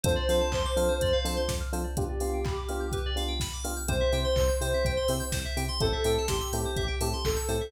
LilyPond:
<<
  \new Staff \with { instrumentName = "Ocarina" } { \time 4/4 \key c \major \tempo 4 = 125 c''4 c''2 r4 | g'2~ g'8 r4. | c''4 c''2 r4 | a'4 g'2 a'4 | }
  \new Staff \with { instrumentName = "Electric Piano 1" } { \time 4/4 \key c \major <c' d' f' a'>8 <c' d' f' a'>4 <c' d' f' a'>4 <c' d' f' a'>4 <c' d' f' a'>8 | <b d' f' g'>8 <b d' f' g'>4 <b d' f' g'>4 <b d' f' g'>4 <b d' f' g'>8 | <c' e' g'>8 <c' e' g'>4 <c' e' g'>4 <c' e' g'>4 <c' e' g'>8 | <c' e' g' a'>8 <c' e' g' a'>4 <c' e' g' a'>4 <c' e' g' a'>4 <c' e' g' a'>8 | }
  \new Staff \with { instrumentName = "Electric Piano 2" } { \time 4/4 \key c \major c''16 d''16 f''16 a''16 c'''16 d'''16 f'''16 c''16 d''16 f''16 a''16 c'''16 d'''16 f'''16 c''16 d''16 | b'16 d''16 f''16 g''16 b''16 d'''16 f'''16 g'''16 b'16 d''16 f''16 g''16 b''16 d'''16 f'''16 g'''16 | c''16 e''16 g''16 c'''16 e'''16 g'''16 c''16 e''16 g''16 c'''16 e'''16 g'''16 c''16 e''16 g''16 c'''16 | c''16 e''16 g''16 a''16 c'''16 e'''16 g'''16 c''16 e''16 g''16 a''16 c'''16 e'''16 g'''16 c''16 e''16 | }
  \new Staff \with { instrumentName = "Synth Bass 1" } { \clef bass \time 4/4 \key c \major f,8 f8 f,8 f8 f,8 f8 f,8 f8 | r1 | c,8 c8 c,8 c8 c,8 c8 c,8 c8 | a,,8 a,8 a,,8 a,8 a,,8 a,8 a,,8 a,8 | }
  \new DrumStaff \with { instrumentName = "Drums" } \drummode { \time 4/4 <hh bd>8 hho8 <hc bd>8 hho8 <hh bd>8 hho8 <bd sn>8 hho8 | <hh bd>8 hho8 <hc bd>8 hho8 <hh bd>8 hho8 <bd sn>8 hho8 | <hh bd>8 hho8 <hc bd>8 hho8 <hh bd>8 hho8 <bd sn>8 hho8 | <hh bd>8 hho8 <bd sn>8 hho8 <hh bd>8 hho8 <hc bd>8 hho8 | }
>>